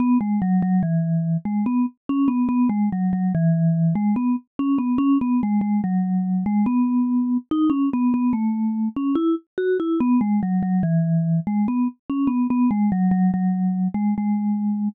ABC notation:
X:1
M:3/4
L:1/16
Q:1/4=72
K:E
V:1 name="Vibraphone"
B, G, F, F, E,3 G, B, z C B, | B, G, F, F, E,3 G, B, z C B, | C B, G, G, F,3 G, B,4 | D C B, B, A,3 C E z F E |
B, G, F, F, E,3 G, B, z C B, | B, G, F, F, F,3 G, G,4 |]